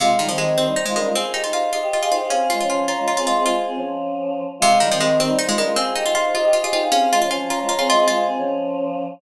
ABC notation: X:1
M:6/8
L:1/16
Q:3/8=104
K:Fm
V:1 name="Ocarina"
[Af]2 z2 [Ge]2 [Ec] [Ec] [Ec] [Ec] [DB] [DB] | [ca]2 z2 [Af]2 [Ge] [Ge] [Ge] [Ge] [Ec] [Ec] | [Af]2 z2 [ca]2 [db] [db] [db] [db] [ec'] [ec'] | [ca]4 z8 |
[Af]2 z2 [Ge]2 [Ec] [Ec] [Ec] [Ec] [DB] [DB] | [ca]2 z2 [Af]2 [Ge] [Ge] [Ge] [Ge] [Ec] [Ec] | [Af]2 z2 [ca]2 [db] [db] [db] [db] [ec'] [ec'] | [ca]4 z8 |]
V:2 name="Choir Aahs"
[A,F]2 [G,E] [E,C] [E,C]2 [E,C] [G,E] z [A,F] [G,E] [A,F] | [Af]2 [Ge] [Ec] [Ec]2 [Ec] [Ge] z [Af] [Ge] [Af] | [CA]2 [A,F] [F,D] [F,D]2 [F,D] [A,F] z [CA] [A,F] [CA] | [A,F]2 [CA] [F,D]7 z2 |
[A,F]2 [G,E] [E,C] [E,C]2 [E,C] [G,E] z [A,F] [G,E] [A,F] | [Af]2 [Ge] [Ec] [Ec]2 [Ec] [Ge] z [Af] [Ge] [Af] | [CA]2 [A,F] [F,D] [F,D]2 [F,D] [A,F] z [CA] [A,F] [CA] | [A,F]2 [CA] [F,D]7 z2 |]
V:3 name="Harpsichord"
C,2 E, F, A,2 C2 E A, A,2 | C2 E F F2 F2 F F F2 | D2 F F F2 F2 F F F2 | F6 z6 |
C,2 E, F, A,2 C2 E A, A,2 | C2 E F F2 F2 F F F2 | D2 F F F2 F2 F F F2 | F6 z6 |]